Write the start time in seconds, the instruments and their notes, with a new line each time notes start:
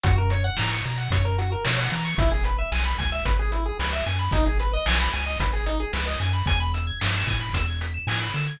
0.03 synth bass 1 F#2, lead 1 (square) F#4, kick, closed hi-hat
0.18 lead 1 (square) A#4
0.30 lead 1 (square) C#5, closed hi-hat
0.44 lead 1 (square) F#5
0.57 synth bass 1 A2, lead 1 (square) A#5, snare
0.71 lead 1 (square) C#6
0.84 synth bass 1 B2, lead 1 (square) A#5, closed hi-hat
0.98 lead 1 (square) F#5
1.10 synth bass 1 F#2, lead 1 (square) C#5, kick, closed hi-hat
1.25 lead 1 (square) A#4
1.38 lead 1 (square) F#4, closed hi-hat
1.52 lead 1 (square) A#4
1.65 synth bass 1 B2, lead 1 (square) C#5, snare
1.79 lead 1 (square) F#5
1.91 synth bass 1 E3, lead 1 (square) A#5, closed hi-hat
2.05 lead 1 (square) C#6
2.18 synth bass 1 G#1, lead 1 (square) E4, kick, closed hi-hat
2.32 lead 1 (square) G#4
2.44 lead 1 (square) B4, closed hi-hat
2.58 lead 1 (square) E5
2.72 synth bass 1 B1, lead 1 (square) G#5, snare
2.85 lead 1 (square) B5
2.98 synth bass 1 C#2, lead 1 (square) G#5, kick, closed hi-hat
3.12 lead 1 (square) E5
3.25 synth bass 1 G#1, lead 1 (square) B4, kick, closed hi-hat
3.39 lead 1 (square) G#4
3.52 lead 1 (square) E4, closed hi-hat
3.66 lead 1 (square) G#4
3.79 synth bass 1 C#2, lead 1 (square) B4, snare
3.93 lead 1 (square) E5
4.06 synth bass 1 F#2, lead 1 (square) G#5, closed hi-hat
4.19 lead 1 (square) B5
4.31 synth bass 1 G#1, lead 1 (square) D#4, kick, closed hi-hat
4.46 lead 1 (square) G#4
4.59 lead 1 (square) B4, closed hi-hat
4.73 lead 1 (square) D#5
4.86 synth bass 1 B1, lead 1 (square) G#5, snare
5.00 lead 1 (square) B5
5.12 synth bass 1 C#2, lead 1 (square) G#5, closed hi-hat
5.26 lead 1 (square) D#5
5.40 synth bass 1 G#1, lead 1 (square) B4, kick, closed hi-hat
5.53 lead 1 (square) G#4
5.66 lead 1 (square) D#4, closed hi-hat
5.80 lead 1 (square) G#4
5.93 synth bass 1 C#2, lead 1 (square) B4, snare
6.07 lead 1 (square) D#5
6.20 synth bass 1 F#2, lead 1 (square) G#5, closed hi-hat
6.33 lead 1 (square) B5
6.46 synth bass 1 E2, lead 1 (square) G#5, kick, closed hi-hat
6.60 lead 1 (square) B5
6.74 lead 1 (square) E6, closed hi-hat
6.87 lead 1 (square) G#6
7.00 synth bass 1 G2, lead 1 (square) B6, snare
7.14 lead 1 (square) E7
7.27 synth bass 1 A2, lead 1 (square) G#5, kick, closed hi-hat
7.41 lead 1 (square) B5
7.53 synth bass 1 E2, lead 1 (square) E6, kick, closed hi-hat
7.68 lead 1 (square) G#6
7.81 lead 1 (square) B6, closed hi-hat
7.94 lead 1 (square) E7
8.07 synth bass 1 A2, lead 1 (square) G#5, snare
8.21 lead 1 (square) B5
8.34 synth bass 1 D3, lead 1 (square) E6, closed hi-hat
8.48 lead 1 (square) G#6